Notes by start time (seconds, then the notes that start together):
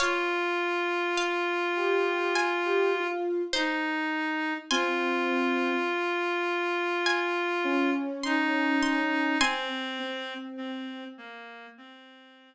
0.00 F4 C#5 F5
1.17 F5
1.76 G4
2.36 G#5
2.65 G4
2.94 F4
3.53 D#4 C5
4.71 C4 F4 G#5 C6
7.06 G#5
7.64 C#4
8.24 D#4 C6
8.83 C6
9.40 C4 G#5 C6
9.99 C4
10.57 C4
11.18 A#3
11.77 C4